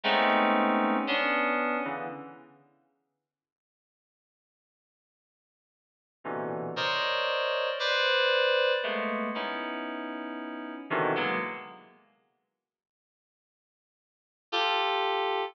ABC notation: X:1
M:3/4
L:1/16
Q:1/4=58
K:none
V:1 name="Electric Piano 2"
[_A,=A,B,C_D_E]4 [B,D=D]3 [_D,=D,=E,] z4 | z12 | [_B,,=B,,C,D,E,]2 [_Bc_d=d_e]4 [=Bcd]4 [_A,=A,_B,=B,]2 | [B,_D_E=E]6 [B,,C,=D,_E,=E,] [_G,_A,_B,=B,] z4 |
z8 [FGA]4 |]